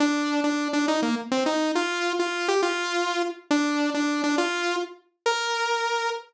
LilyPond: \new Staff { \time 6/8 \key bes \major \tempo 4. = 137 d'4. d'4 d'8 | ees'8 bes8 r8 c'8 ees'4 | f'4. f'4 g'8 | f'2~ f'8 r8 |
d'4. d'4 d'8 | f'4. r4. | bes'2. | }